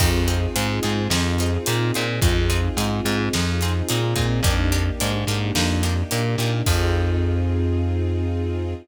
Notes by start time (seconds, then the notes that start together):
0.00 F2 C4 D#4 F4 G#4, kick, crash
0.28 C4 D#4 F4 G#4, closed hi-hat
0.56 G#2 C4 D#4 F4 G#4, closed hi-hat
0.83 G#2 C4 D#4 F4 G#4, closed hi-hat
1.10 F2 C4 D#4 F4 G#4, snare
1.38 C4 D#4 F4 G#4, snare, closed hi-hat
1.66 A#2 C4 D#4 F4 G#4, closed hi-hat
1.94 A#2 C4 D#4 F4 G#4, closed hi-hat
2.22 F2 C4 D#4 F4 G#4, kick, closed hi-hat
2.50 C4 D#4 F4 G#4, closed hi-hat
2.77 G#2 C4 D#4 F4 G#4, closed hi-hat
3.05 G#2 C4 D#4 F4 G#4, closed hi-hat
3.33 F2 C4 D#4 F4 G#4, snare
3.61 C4 D#4 F4 G#4, snare, closed hi-hat
3.89 A#2 C4 D#4 F4 G#4, closed hi-hat
4.16 A#2 C4 D#4 F4 G#4, kick, closed hi-hat
4.43 F2 A#3 D4 D#4 G4, kick, closed hi-hat
4.72 A#3 D4 D#4 G4, closed hi-hat
5.00 G#2 A#3 D4 D#4 G4, closed hi-hat
5.27 G#2 A#3 D4 D#4 G4, closed hi-hat
5.55 F2 A#3 D4 D#4 G4, snare
5.83 A#3 D4 D#4 G4, snare, closed hi-hat
6.11 A#2 A#3 D4 D#4 G4, closed hi-hat
6.38 A#2 A#3 D4 D#4 G4, closed hi-hat
6.66 F2 C4 D#4 F4 G#4, kick, crash